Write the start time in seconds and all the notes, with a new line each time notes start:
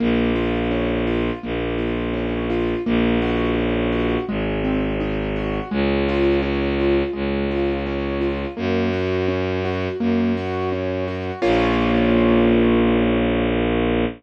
0.00 A#1 A#3
0.35 F4
0.71 C#4
1.07 F4
1.43 A#1 A#3
1.78 F4
2.14 C#4
2.50 F4
2.86 A#1 A#3
3.22 F#4
3.58 C#4
3.92 F#4
4.29 G#1 G#3
4.64 C4
5.00 D#4
5.36 F#4
5.71 C#2 G#3
6.09 F4
6.42 C#4
6.79 F4
7.13 C#2 G#3
7.51 F4
7.86 C#4
8.21 F4
8.57 F#2 A#3
8.93 F#4
9.28 C#4
9.65 F#4
10.00 F#2 A#3
10.37 F#4
10.72 C#4
11.08 F#4
11.42 A#1 A#3 C#4 F4